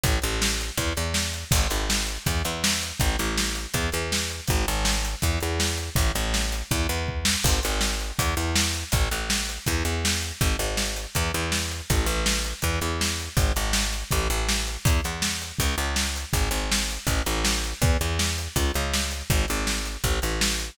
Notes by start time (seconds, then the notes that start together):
0.04 A1, kick, closed hi-hat
0.22 A1, closed hi-hat
0.42 snare
0.61 closed hi-hat
0.77 E2, kick, closed hi-hat
0.97 E2, closed hi-hat
1.14 snare
1.33 closed hi-hat
1.51 G#1, kick, crash
1.70 G#1, closed hi-hat
1.90 snare
2.07 closed hi-hat
2.26 E2, kick, closed hi-hat
2.45 E2, closed hi-hat
2.64 snare
2.83 closed hi-hat
3.00 A1, kick, closed hi-hat
3.19 A1, closed hi-hat
3.38 snare
3.55 closed hi-hat
3.74 E2, kick, closed hi-hat
3.92 E2, closed hi-hat
4.12 snare
4.30 closed hi-hat
4.48 G#1, kick, closed hi-hat
4.68 G#1, closed hi-hat
4.85 snare
5.05 closed hi-hat
5.22 E2, kick, closed hi-hat
5.40 E2, closed hi-hat
5.60 snare
5.78 closed hi-hat
5.96 A1, kick, closed hi-hat
6.15 A1, closed hi-hat
6.34 snare
6.52 closed hi-hat
6.71 E2, kick, closed hi-hat
6.89 E2, closed hi-hat
7.08 kick
7.25 snare
7.44 G#1, kick, crash
7.63 G#1, closed hi-hat
7.81 snare
8.00 closed hi-hat
8.19 E2, kick, closed hi-hat
8.37 E2, closed hi-hat
8.56 snare
8.74 closed hi-hat
8.92 A1, kick, closed hi-hat
9.11 A1, closed hi-hat
9.30 snare
9.49 closed hi-hat
9.66 E2, kick, closed hi-hat
9.85 E2, closed hi-hat
10.05 snare
10.22 closed hi-hat
10.41 G#1, kick, closed hi-hat
10.59 G#1, closed hi-hat
10.77 snare
10.96 closed hi-hat
11.15 E2, kick, closed hi-hat
11.34 E2, closed hi-hat
11.52 snare
11.71 closed hi-hat
11.90 A1, kick, closed hi-hat
12.06 A1, closed hi-hat
12.26 snare
12.44 closed hi-hat
12.62 E2, kick, closed hi-hat
12.81 E2, closed hi-hat
13.01 snare
13.20 closed hi-hat
13.37 G#1, kick, closed hi-hat
13.56 G#1, closed hi-hat
13.73 snare
13.93 closed hi-hat
14.11 A1, kick, closed hi-hat
14.30 A1, closed hi-hat
14.49 snare
14.67 closed hi-hat
14.85 E2, kick, closed hi-hat
15.04 E2, closed hi-hat
15.22 snare
15.42 closed hi-hat
15.59 C#2, kick, closed hi-hat
15.78 C#2, closed hi-hat
15.96 snare
16.16 closed hi-hat
16.33 G#1, kick, closed hi-hat
16.51 G#1, closed hi-hat
16.72 snare
16.90 closed hi-hat
17.07 A1, kick, closed hi-hat
17.26 A1, closed hi-hat
17.45 snare
17.64 closed hi-hat
17.82 E2, kick, closed hi-hat
18.01 E2, closed hi-hat
18.19 snare
18.38 closed hi-hat
18.56 C#2, kick, closed hi-hat
18.74 C#2, closed hi-hat
18.94 snare
19.11 closed hi-hat
19.30 G#1, kick, closed hi-hat
19.48 G#1, closed hi-hat
19.67 snare
19.85 closed hi-hat
20.04 A1, kick, closed hi-hat
20.22 A1, closed hi-hat
20.41 snare
20.59 closed hi-hat